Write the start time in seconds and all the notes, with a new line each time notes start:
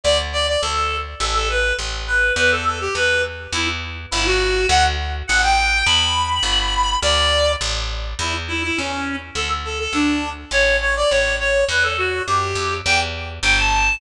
0.04 D2 D5
0.33 D5
0.48 D5
0.62 D2 A4
1.20 A1 A4
1.34 A4
1.49 B4
1.79 A1
2.07 B4
2.36 E2 B4
2.51 A4
2.65 A4
2.80 G4
2.95 E2 B4
3.53 E2 E4
4.11 G1 E4
4.26 F#4
4.69 D2 F#5
5.27 A1 F#5
5.42 G5
5.86 E2 B5
6.43 G1
7.02 D2 D5
7.61 A1
8.19 E2 E4
8.48 E4
8.63 E4
8.77 E2 C#4
9.35 D2 A4
9.65 A4
9.79 A4
9.93 D2 D4
10.51 A1 C#5
10.81 C#5
10.96 D5
11.10 A1 C#5
11.40 C#5
11.69 E2 B4
11.83 A4
11.98 F#4
12.27 F#2 G4
12.55 F2
12.85 E2 G5
13.43 G1 G5
13.58 A5